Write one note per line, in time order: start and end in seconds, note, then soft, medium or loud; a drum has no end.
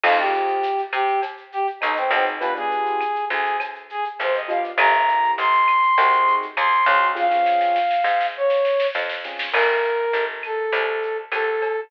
0.04 0.79 F2 loud
0.04 0.16 C4 loud
0.04 0.16 D#4 loud
0.04 0.18 F4 medium
0.04 0.16 F4 loud
0.04 0.16 G#4 loud
0.04 crash loud
0.04 cowbell loud
0.04 claves loud
0.18 0.66 C4 loud
0.18 0.66 D#4 medium
0.18 0.66 F4 medium
0.18 0.81 G4 medium
0.18 0.66 G#4 medium
0.18 shaker medium
0.33 shaker medium
0.48 shaker medium
0.63 tambourine medium
0.63 shaker loud
0.78 shaker medium
0.93 1.69 C3 medium
0.93 1.21 G4 medium
0.93 claves loud
0.93 shaker medium
1.08 shaker medium
1.22 cowbell medium
1.22 shaker loud
1.37 shaker medium
1.52 1.67 G4 medium
1.52 shaker medium
1.67 shaker medium
1.81 2.10 B1 medium
1.81 1.95 D#4 medium
1.81 tambourine medium
1.81 cowbell medium
1.81 claves medium
1.81 shaker loud
1.97 2.11 C4 medium
1.97 shaker medium
2.11 3.16 B1 loud
2.11 2.25 C4 medium
2.11 2.36 C4 medium
2.11 2.36 D#4 medium
2.11 2.36 F4 medium
2.11 2.36 G#4 loud
2.11 cowbell medium
2.11 shaker medium
2.26 shaker medium
2.40 2.53 B3 loud
2.40 2.53 D4 loud
2.40 2.53 F4 loud
2.40 2.53 G4 loud
2.40 2.54 B4 medium
2.40 cowbell medium
2.40 shaker loud
2.55 3.03 B3 loud
2.55 3.03 D4 loud
2.55 3.03 F4 medium
2.55 3.03 G4 medium
2.55 3.25 G#4 medium
2.55 shaker medium
2.71 shaker medium
2.86 shaker medium
3.01 tambourine medium
3.01 claves medium
3.01 shaker loud
3.15 shaker medium
3.30 4.06 D2 medium
3.30 3.57 G#4 medium
3.30 shaker medium
3.45 shaker medium
3.60 cowbell medium
3.60 claves loud
3.60 shaker loud
3.75 shaker medium
3.90 4.05 G#4 medium
3.90 shaker medium
4.05 shaker medium
4.19 4.70 G1 medium
4.19 4.35 C5 medium
4.19 tambourine medium
4.19 cowbell medium
4.19 shaker loud
4.34 4.49 D#5 medium
4.34 shaker medium
4.48 4.72 B3 medium
4.48 4.72 D4 medium
4.48 4.72 F4 loud
4.48 4.72 G4 loud
4.48 4.64 F5 medium
4.48 cowbell medium
4.48 shaker medium
4.64 shaker medium
4.78 5.31 G1 loud
4.78 4.92 A#3 loud
4.78 4.92 C4 loud
4.78 4.92 E4 loud
4.78 4.92 G4 loud
4.78 5.32 A#5 loud
4.78 cowbell loud
4.78 claves loud
4.78 shaker loud
4.93 5.41 A#3 loud
4.93 5.41 C4 loud
4.93 5.41 E4 medium
4.93 5.41 G4 medium
4.93 shaker medium
5.08 shaker medium
5.23 shaker medium
5.38 5.92 G1 medium
5.38 6.35 C6 medium
5.38 tambourine medium
5.38 shaker loud
5.53 shaker medium
5.68 claves medium
5.68 shaker medium
5.83 shaker medium
5.98 6.51 C2 medium
5.98 6.46 C4 loud
5.98 6.46 D#4 medium
5.98 6.46 F#4 loud
5.98 6.46 G#4 loud
5.98 cowbell medium
5.98 shaker loud
6.12 shaker medium
6.27 shaker medium
6.42 shaker medium
6.57 6.86 D#2 medium
6.57 7.08 C6 medium
6.57 tambourine medium
6.57 cowbell medium
6.57 claves loud
6.57 shaker loud
6.72 shaker medium
6.86 7.92 C#2 loud
6.86 7.12 C4 medium
6.86 7.12 D#4 loud
6.86 7.12 F#4 medium
6.86 7.12 G#4 loud
6.86 cowbell medium
6.86 shaker medium
7.01 shaker medium
7.15 7.27 C4 loud
7.15 7.27 C#4 loud
7.15 7.27 F4 loud
7.15 7.27 G#4 loud
7.15 8.27 F5 medium
7.15 kick medium
7.15 snare medium
7.31 7.78 C4 loud
7.31 7.78 C#4 loud
7.31 7.78 F4 loud
7.31 7.78 G#4 loud
7.31 snare medium
7.46 snare medium
7.61 snare medium
7.76 snare medium
7.91 snare medium
8.04 8.80 G#2 medium
8.04 snare medium
8.21 snare medium
8.37 8.87 C#5 medium
8.50 snare medium
8.65 snare medium
8.80 snare loud
8.95 9.46 F2 medium
8.95 snare loud
9.09 snare loud
9.24 9.49 C4 medium
9.24 9.49 C#4 loud
9.24 9.49 F4 loud
9.24 9.49 G#4 loud
9.24 snare medium
9.39 snare loud
9.52 10.07 G1 medium
9.52 10.24 A#4 medium
9.52 crash loud
9.52 cowbell loud
9.52 claves loud
9.84 shaker medium
10.13 10.67 G1 medium
10.13 tambourine medium
10.13 shaker loud
10.43 11.17 A4 medium
10.43 claves medium
10.43 shaker medium
10.73 11.26 C2 medium
10.73 cowbell medium
10.73 shaker loud
11.03 shaker medium
11.32 11.85 C2 medium
11.32 11.81 A4 medium
11.32 tambourine medium
11.32 cowbell medium
11.32 claves loud
11.32 shaker loud
11.62 cowbell medium
11.62 shaker medium